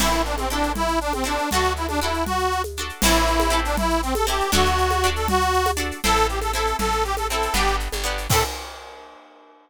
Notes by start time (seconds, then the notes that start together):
0.00 A1 C4 E4 A4, crash, low conga, shaker
0.13 shaker
0.25 D4, shaker
0.38 C4, high conga, shaker
0.50 C4 D4 E4 A4, shaker
0.63 shaker
0.75 E4, low conga, shaker
0.88 shaker
1.01 D4, shaker
1.13 C4, high conga, shaker
1.24 C4 D4 E4 A4, shaker
1.38 shaker
1.51 D2 D4 F#4, low conga, shaker
1.55 A4
1.64 shaker
1.76 E4, shaker
1.89 D4, high conga, shaker
2.01 D4 E4 F#4 A4, shaker
2.14 shaker
2.26 F#4, low conga, shaker
2.39 shaker
2.52 shaker
2.64 high conga, shaker
2.77 D4 F#4 A4, shaker
2.89 shaker
3.02 A1 C4 E4, crash, low conga, shaker
3.07 A4
3.14 shaker
3.27 shaker
3.40 high conga, shaker
3.50 C4 E4 A4, shaker
3.65 D4, shaker
3.77 E4, low conga, shaker
3.90 shaker
4.03 C4, shaker
4.15 A4, high conga, shaker
4.27 C4 E4 G4 A4, shaker
4.40 shaker
4.52 D2 D4 F#4 A4, low conga, shaker
4.65 shaker
4.78 shaker
4.91 high conga, shaker
5.03 D4 F#4 A4, shaker
5.16 A4, shaker
5.28 F#4, low conga, shaker
5.41 shaker
5.53 shaker
5.66 high conga, shaker
5.77 D4 F#4 A4, shaker
5.91 shaker
6.04 A1 C4 E4 A4, low conga, shaker
6.16 shaker
6.29 G4, shaker
6.42 A4, high conga, shaker
6.53 C4 E4 A4, shaker
6.67 shaker
6.79 A1 A4, low conga, shaker
6.92 shaker
7.04 G4, shaker
7.17 A4, high conga, shaker
7.30 C4 E4 A4, shaker
7.42 shaker
7.54 G1 B3 D4 G4, low conga, shaker
7.67 shaker
7.80 shaker
7.92 G1, high conga, shaker
8.04 B3 D4 G4, shaker
8.18 shaker
8.30 A2 C4 E4 A4, kick, crash
8.34 A4